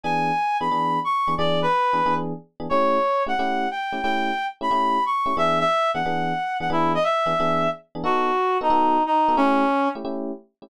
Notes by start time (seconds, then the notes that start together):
0.03 E3 B3 D4 G#4 G#5
0.60 E3 B3 D4 G#4 B5
0.71 E3 B3 D4 G#4
1.04 C#6
1.28 E3 B3 D4 G#4
1.38 E3 B3 D4 G#4 D5
1.62 B4
1.93 E3 B3 D4 G#4
2.06 E3 B3 D4 G#4
2.60 E3 B3 D4 G#4
2.69 A3 C#4 E4 G4 C#5
3.27 A3 C#4 E4 G4 F#5
3.39 A3 C#4 E4 G4
3.71 G5
3.92 A3 C#4 E4 G4
4.02 A3 C#4 E4 G4 G5
4.61 A3 C#4 E4 G4 B5
4.71 A3 C#4 E4 G4
5.06 C#6
5.26 A3 C#4 E4 G4
5.37 E3 B3 D4 G#4 E5
5.59 E5
5.94 E3 B3 D4 G#4 F#5
6.06 E3 B3 D4 G#4
6.60 E3 B3 D4 G#4 F#5
6.70 E3 B3 D4 E4 G#4
6.95 D#5
7.03 E5
7.26 E3 B3 D4 G#4
7.40 E3 B3 D4 G#4
7.95 E3 B3 D4 G#4
8.04 B3 D#4 F#4 A4
8.61 B3 D#4 F#4 A4
8.70 B3 D#4 F#4 A4
9.06 D#4
9.28 B3 D#4 F#4 A4
9.37 A3 C#4 E4 G4
9.95 A3 C#4 E4 G4
10.05 A3 C#4 E4 G4
10.62 A3 C#4 E4 G4